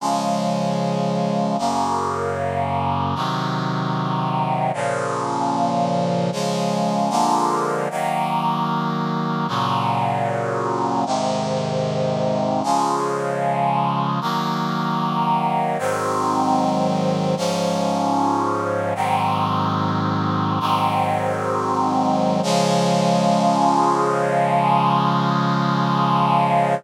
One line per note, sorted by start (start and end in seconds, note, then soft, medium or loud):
0.00 1.56 C#3 medium
0.00 1.56 F3 medium
0.00 1.56 G#3 medium
1.58 3.15 F#2 medium
1.58 3.15 C#3 medium
1.58 3.15 A#3 medium
3.15 4.71 C3 medium
3.15 4.71 D#3 medium
3.15 4.71 F#3 medium
4.74 6.30 A#2 medium
4.74 6.30 C#3 medium
4.74 6.30 F3 medium
6.32 7.11 C#3 medium
6.32 7.09 F3 medium
6.32 7.09 G#3 medium
7.10 7.88 D3 medium
7.10 7.88 F3 medium
7.10 7.88 G#3 medium
7.10 7.88 A#3 medium
7.90 9.47 D#3 medium
7.90 9.47 F#3 medium
7.90 9.47 A#3 medium
9.48 11.04 A#2 medium
9.48 11.04 C#3 medium
9.48 11.04 F#3 medium
11.06 12.62 G#2 medium
11.06 12.62 C3 medium
11.06 12.62 D#3 medium
12.63 14.20 C#3 medium
12.63 14.20 F3 medium
12.63 14.20 G#3 medium
14.21 15.77 D#3 medium
14.21 15.77 F#3 medium
14.21 15.77 A#3 medium
15.79 17.35 G#2 medium
15.79 17.35 D#3 medium
15.79 17.35 F#3 medium
15.79 17.35 C4 medium
17.37 18.93 G#2 medium
17.37 18.93 F3 medium
17.37 18.93 C#4 medium
18.95 20.59 G#2 medium
18.95 20.59 D#3 medium
18.95 20.59 F#3 medium
18.95 20.59 C4 medium
20.60 22.41 G#2 medium
20.60 22.41 D#3 medium
20.60 22.41 F#3 medium
20.60 22.41 C4 medium
22.43 26.75 C#3 loud
22.43 26.75 F3 loud
22.43 26.75 G#3 loud